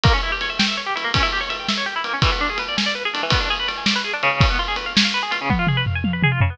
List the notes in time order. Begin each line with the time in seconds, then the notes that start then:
0.03 A#3, kick, ride
0.13 C#4
0.23 E4
0.32 G4
0.41 C#5, ride
0.50 E5
0.59 G5, snare
0.68 E5
0.77 C#5
0.86 G4
0.96 E4, ride
1.04 A#3
1.14 C#4, kick, ride
1.23 E4
1.32 G4
1.41 C#5
1.49 E5, ride
1.59 G5
1.68 E5, snare
1.77 C#5
1.86 G4
1.96 E4
2.04 A#3, ride
2.13 C#4
2.22 E3, kick, ride
2.32 B3
2.41 D4
2.50 G#4
2.58 B4, ride
2.68 D5
2.77 G#5, snare
2.86 D5
2.95 B4
3.05 G#4
3.13 D4, ride
3.23 E3
3.30 B3, kick, ride
3.40 D4
3.50 G#4
3.59 B4
3.68 D5, ride
3.77 G#5
3.86 D5, snare
3.96 B4
4.04 G#4
4.13 D4
4.23 C#3, ride
4.41 kick, ride
4.50 B3
4.59 F4
4.68 G#4
4.76 B4, ride
4.86 F5
4.96 G#5, snare
5.05 F5
5.14 B4
5.23 G#4
5.31 F4, ride
5.41 C#3
5.50 B3, kick, high tom
5.59 F4
5.67 G#4, mid tom
5.77 B4
5.86 F5, floor tom
5.95 G#5
6.04 F5, high tom
6.13 B4
6.22 G#4, mid tom
6.32 F4
6.41 C#3, floor tom
6.50 B3